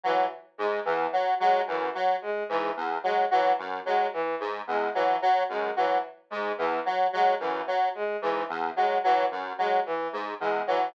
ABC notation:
X:1
M:5/4
L:1/8
Q:1/4=110
K:none
V:1 name="Lead 1 (square)" clef=bass
^F, z ^G,, E,, F, F, ^F,, F, z G,, | E,, ^F, F, ^F,, F, z ^G,, E,, F, F, | ^F,, ^F, z ^G,, E,, F, F, F,, F, z | ^G,, E,, ^F, F, ^F,, F, z G,, E,, F, |]
V:2 name="Violin" clef=bass
E, z ^G, E, z G, E, z G, E, | z ^G, E, z G, E, z G, E, z | ^G, E, z G, E, z G, E, z G, | E, z ^G, E, z G, E, z G, E, |]